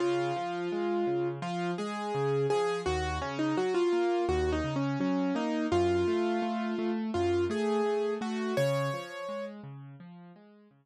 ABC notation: X:1
M:4/4
L:1/16
Q:1/4=84
K:Db
V:1 name="Acoustic Grand Piano"
F8 F2 A4 A2 | G2 D E G F3 (3G2 E2 D2 D2 E2 | F8 F2 A4 G2 | d6 z10 |]
V:2 name="Acoustic Grand Piano"
D,2 F,2 A,2 D,2 F,2 A,2 D,2 F,2 | E,,2 D,2 G,2 B,2 E,,2 D,2 G,2 B,2 | G,,2 =A,2 A,2 A,2 G,,2 A,2 A,2 A,2 | D,2 F,2 A,2 D,2 F,2 A,2 D,2 z2 |]